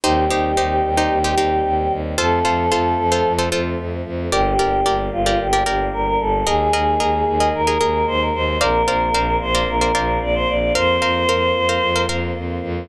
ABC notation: X:1
M:4/4
L:1/16
Q:1/4=112
K:Bb
V:1 name="Choir Aahs"
G16 | A10 z6 | G6 F2 G4 B B A2 | _A6 A2 B4 c B c2 |
B6 c2 B4 d c d2 | c10 z6 |]
V:2 name="Pizzicato Strings"
[EGc]2 [EGc]2 [EGc]3 [EGc]2 [EGc] [EGc]6 | [FAc]2 [FAc]2 [FAc]3 [FAc]2 [FAc] [FAc]6 | [GBd]2 [GBd]2 [GBd]3 [GBd]2 [GBd] [GBd]6 | [_ABe]2 [ABe]2 [ABe]3 [ABe]2 [ABe] [ABe]6 |
[Bcdf]2 [Bcdf]2 [Bcdf]3 [Bcdf]2 [Bcdf] [Bcdf]6 | [Bcf]2 [Bcf]2 [Bcf]3 [Bcf]2 [Bcf] [Bcf]6 |]
V:3 name="Violin" clef=bass
E,,2 E,,2 E,,2 E,,2 E,,2 E,,2 E,,2 E,,2 | F,,2 F,,2 F,,2 F,,2 F,,2 F,,2 F,,2 F,,2 | G,,,2 G,,,2 G,,,2 G,,,2 G,,,2 G,,,2 G,,,2 G,,,2 | E,,2 E,,2 E,,2 E,,2 E,,2 E,,2 E,,2 E,,2 |
B,,,2 B,,,2 B,,,2 B,,,2 B,,,2 B,,,2 B,,,2 B,,,2 | F,,2 F,,2 F,,2 F,,2 F,,2 F,,2 F,,2 F,,2 |]
V:4 name="Choir Aahs"
[G,CE]16 | [F,A,C]16 | [G,B,D]16 | [_A,B,E]16 |
[B,CDF]16 | [B,CF]16 |]